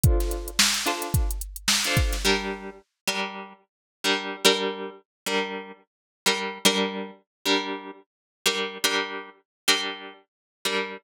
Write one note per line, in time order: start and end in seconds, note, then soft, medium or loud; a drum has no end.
0.04 0.50 D4 loud
0.04 0.50 F4 medium
0.04 0.50 A4 loud
0.04 0.50 C5 loud
0.04 kick loud
0.04 closed hi-hat loud
0.20 snare soft
0.20 closed hi-hat medium
0.31 closed hi-hat medium
0.48 closed hi-hat medium
0.59 snare loud
0.74 closed hi-hat medium
0.86 1.31 D4 medium
0.86 1.31 F4 medium
0.86 1.31 A4 medium
0.86 1.31 C5 medium
0.86 snare soft
0.86 closed hi-hat medium
1.02 closed hi-hat medium
1.14 kick medium
1.14 closed hi-hat loud
1.31 closed hi-hat medium
1.41 closed hi-hat medium
1.56 closed hi-hat medium
1.68 snare loud
1.84 2.17 D4 medium
1.84 2.17 F4 medium
1.84 2.17 A4 medium
1.84 2.17 C5 loud
1.84 closed hi-hat medium
1.97 kick loud
1.97 closed hi-hat medium
2.13 snare medium
2.13 closed hi-hat medium
2.25 2.70 G3 loud
2.25 2.70 D4 medium
2.25 2.70 A#4 medium
3.07 3.53 G3 medium
3.07 3.53 D4 medium
3.07 3.53 A#4 medium
4.04 4.36 G3 medium
4.04 4.36 D4 medium
4.04 4.36 A#4 medium
4.45 4.90 G3 loud
4.45 4.90 D4 loud
4.45 4.90 A#4 loud
5.26 5.72 G3 medium
5.26 5.72 D4 medium
5.26 5.72 A#4 medium
6.26 6.58 G3 medium
6.26 6.58 D4 medium
6.26 6.58 A#4 medium
6.65 7.11 G3 loud
6.65 7.11 D4 loud
6.65 7.11 A#4 loud
7.46 7.91 G3 loud
7.46 7.91 D4 medium
7.46 7.91 A#4 medium
8.46 8.78 G3 medium
8.46 8.78 D4 medium
8.46 8.78 A#4 loud
8.84 9.30 G3 loud
8.84 9.30 D4 loud
8.84 9.30 A#4 loud
9.68 10.13 G3 loud
9.68 10.13 D4 medium
9.68 10.13 A#4 medium
10.65 10.97 G3 medium
10.65 10.97 D4 medium
10.65 10.97 A#4 medium